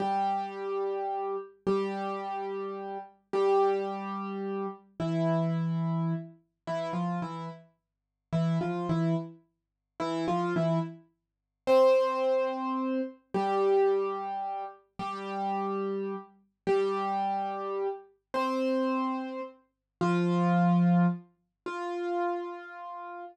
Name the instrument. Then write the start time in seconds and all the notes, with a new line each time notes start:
acoustic grand piano
0.00 G3 G4
1.67 G3 G4
3.33 G3 G4
5.00 E3 E4
6.67 E3 E4
6.93 F3 F4
7.22 E3 E4
8.33 E3 E4
8.61 F3 F4
8.89 E3 E4
10.00 E3 E4
10.28 F3 F4
10.56 E3 E4
11.67 C4 C5
13.34 G3 G4
14.99 G3 G4
16.67 G3 G4
18.34 C4 C5
20.01 F3 F4
21.66 F4